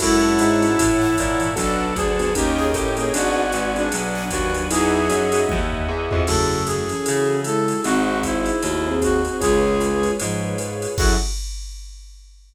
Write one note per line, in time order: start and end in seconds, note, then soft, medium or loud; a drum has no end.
0.00 0.38 F#2 medium
0.00 0.66 G#3 medium
0.00 0.16 C#4 loud
0.00 0.16 E4 loud
0.00 1.50 E4 medium
0.00 0.66 E4 medium
0.00 0.16 F#4 loud
0.00 0.16 A4 loud
0.00 1.55 C#5 medium
0.00 1.55 E5 medium
0.00 1.55 F#5 medium
0.00 1.55 A5 medium
0.00 kick medium
0.00 crash loud
0.00 ride loud
0.23 0.48 C#4 medium
0.23 0.48 E4 medium
0.23 0.48 F#4 medium
0.23 0.48 A4 medium
0.38 0.76 G#2 medium
0.38 hi-hat pedal medium
0.38 ride medium
0.62 0.87 C#4 medium
0.62 0.87 E4 medium
0.62 0.87 F#4 medium
0.62 0.87 A4 medium
0.62 ride medium
0.77 1.12 G#2 medium
0.77 1.16 A2 medium
0.77 1.12 E3 medium
0.77 kick medium
0.77 ride loud
1.01 snare medium
1.17 1.38 G#2 medium
1.17 1.55 A#2 medium
1.17 1.38 E3 medium
1.17 kick medium
1.17 hi-hat pedal medium
1.17 ride medium
1.40 1.55 G#2 medium
1.40 1.55 E3 medium
1.40 ride medium
1.56 1.94 B1 medium
1.56 2.31 F#3 medium
1.56 1.85 B3 loud
1.56 1.85 D4 loud
1.56 2.31 D4 medium
1.56 1.85 F#4 loud
1.56 1.85 A4 loud
1.56 1.93 A4 medium
1.56 2.34 B4 medium
1.56 2.34 D5 medium
1.56 2.34 F#5 medium
1.56 2.34 A5 medium
1.56 kick medium
1.56 ride loud
1.96 2.32 D2 medium
1.96 2.33 G#4 medium
1.96 kick medium
1.96 hi-hat pedal medium
1.96 ride medium
2.19 2.31 B3 loud
2.19 2.31 D4 medium
2.19 2.31 F#4 medium
2.19 2.31 A4 medium
2.19 ride medium
2.35 2.74 D#2 medium
2.35 2.65 A#3 loud
2.35 2.91 C#4 medium
2.35 2.65 C#4 loud
2.35 2.65 D#4 loud
2.35 2.56 G4 medium
2.35 2.65 G4 medium
2.35 2.91 A#4 medium
2.35 3.13 A#4 medium
2.35 3.13 C#5 medium
2.35 3.13 D#5 medium
2.35 3.13 G5 medium
2.35 kick medium
2.35 ride loud
2.57 2.71 G#4 medium
2.57 snare medium
2.74 3.11 A2 medium
2.74 2.96 G4 medium
2.74 kick medium
2.74 hi-hat pedal medium
2.74 ride medium
2.97 3.09 A#3 medium
2.97 3.09 C#4 medium
2.97 3.12 C#4 medium
2.97 3.09 D#4 medium
2.97 3.09 G4 medium
2.97 3.12 G#4 medium
2.97 3.12 A#4 medium
2.97 ride medium
3.13 3.52 G#1 medium
3.13 3.43 B3 loud
3.13 3.43 D4 loud
3.13 3.83 F#4 medium
3.13 3.73 F#4 medium
3.13 3.43 F#4 loud
3.13 3.43 G#4 loud
3.13 4.70 B4 medium
3.13 3.83 D5 medium
3.13 4.70 D5 medium
3.13 4.68 F#5 medium
3.13 4.68 G#5 medium
3.13 ride loud
3.52 3.90 G#1 medium
3.52 hi-hat pedal medium
3.52 ride medium
3.76 4.01 B3 medium
3.76 4.01 D4 medium
3.76 4.23 D4 medium
3.76 4.01 F#4 medium
3.76 4.01 G#4 medium
3.76 ride medium
3.92 4.30 B1 medium
3.92 4.30 F#3 medium
3.92 4.30 D4 medium
3.92 ride loud
4.15 snare medium
4.30 4.68 D#2 medium
4.30 4.51 F#3 medium
4.30 4.51 D4 medium
4.30 4.65 F#4 medium
4.30 kick medium
4.30 hi-hat pedal medium
4.30 ride medium
4.54 4.70 F#3 medium
4.54 4.70 D4 medium
4.54 ride medium
4.69 5.08 E2 medium
4.69 5.29 F#3 medium
4.69 5.00 D#4 loud
4.69 5.29 D#4 medium
4.69 5.00 E4 loud
4.69 5.00 F#4 medium
4.69 5.00 G#4 loud
4.69 5.41 G#4 loud
4.69 6.25 D#5 medium
4.69 6.25 E5 medium
4.69 6.25 F#5 medium
4.69 6.25 G#5 medium
4.69 ride loud
5.09 5.46 F#2 medium
5.09 5.25 D#4 medium
5.09 5.25 E4 loud
5.09 5.25 F#4 medium
5.09 5.25 G#4 medium
5.09 hi-hat pedal medium
5.09 ride medium
5.32 5.58 D#4 medium
5.32 5.58 E4 medium
5.32 5.58 F#4 medium
5.32 5.58 G#4 medium
5.32 ride medium
5.49 5.87 D#2 medium
5.49 kick medium
5.49 high tom medium
5.72 floor tom medium
5.89 6.09 E2 medium
6.11 6.27 F2 medium
6.11 6.22 D#4 medium
6.11 6.22 E4 medium
6.11 6.22 F#4 medium
6.11 6.22 G#4 medium
6.11 floor tom loud
6.27 6.94 F#2 medium
6.27 6.78 C#3 loud
6.27 6.78 A3 loud
6.27 6.57 E4 medium
6.27 7.85 E4 medium
6.27 6.57 F#4 medium
6.27 7.83 F#4 medium
6.27 6.57 G#4 medium
6.27 7.83 G#4 medium
6.27 6.63 A4 medium
6.27 6.57 A4 medium
6.27 7.85 A4 medium
6.27 kick medium
6.27 crash loud
6.27 ride medium
6.66 7.40 G#4 medium
6.66 hi-hat pedal medium
6.66 ride medium
6.89 7.41 E3 medium
6.89 7.41 C#4 medium
6.89 ride medium
7.06 7.74 C#3 medium
7.06 7.36 E4 medium
7.06 7.36 F#4 medium
7.06 7.36 G#4 medium
7.06 7.36 A4 medium
7.06 ride loud
7.44 7.77 G#3 medium
7.44 7.77 E4 medium
7.44 7.81 A4 medium
7.44 hi-hat pedal medium
7.44 ride medium
7.68 ride medium
7.84 8.51 G#1 loud
7.84 8.21 D#3 medium
7.84 8.21 C4 medium
7.84 9.39 D#4 medium
7.84 8.14 D#4 medium
7.84 9.39 F#4 medium
7.84 8.14 F#4 medium
7.84 8.19 F#4 medium
7.84 9.39 G#4 medium
7.84 8.14 G#4 medium
7.84 9.39 C5 medium
7.84 8.14 C5 medium
7.84 ride medium
8.23 8.60 D#4 medium
8.23 8.95 E4 medium
8.23 8.60 C5 medium
8.23 kick medium
8.23 hi-hat pedal medium
8.23 ride medium
8.46 ride medium
8.62 9.28 D#2 medium
8.62 8.84 A3 medium
8.62 8.84 F#4 medium
8.62 ride medium
8.85 9.21 C4 medium
8.85 9.12 D#4 medium
8.85 9.12 F#4 medium
8.85 9.21 G#4 medium
8.85 9.12 G#4 medium
8.85 9.12 C5 medium
9.01 9.37 F#4 medium
9.01 kick medium
9.01 hi-hat pedal medium
9.01 ride medium
9.25 9.41 C4 medium
9.25 9.41 G#4 medium
9.25 ride medium
9.40 10.09 C#2 medium
9.40 10.14 G#3 medium
9.40 10.95 F4 medium
9.40 10.14 F4 loud
9.40 9.70 F4 medium
9.40 10.95 G#4 medium
9.40 10.11 G#4 medium
9.40 9.70 G#4 medium
9.40 10.95 B4 medium
9.40 9.70 B4 medium
9.40 10.95 C#5 medium
9.40 9.70 C#5 medium
9.40 kick medium
9.40 ride loud
9.80 10.09 F4 medium
9.80 10.09 G#4 medium
9.80 10.09 B4 medium
9.80 10.09 C#5 medium
9.80 hi-hat pedal medium
9.80 ride medium
10.03 ride medium
10.20 10.54 G#2 medium
10.20 10.87 G#2 medium
10.20 10.54 F3 medium
10.20 ride loud
10.58 10.89 F4 medium
10.58 10.89 G#4 medium
10.58 10.89 B4 medium
10.58 10.89 C#5 medium
10.58 hi-hat pedal medium
10.58 ride medium
10.82 ride medium
10.97 11.16 F#2 medium
10.97 11.14 F#3 loud
10.97 11.13 E4 medium
10.97 11.14 E4 medium
10.97 11.13 F#4 loud
10.97 11.14 F#4 loud
10.97 11.14 F#4 medium
10.97 11.13 G#4 medium
10.97 11.14 G#4 medium
10.97 11.13 A4 medium
10.97 11.14 A4 medium
10.97 kick loud
10.97 crash loud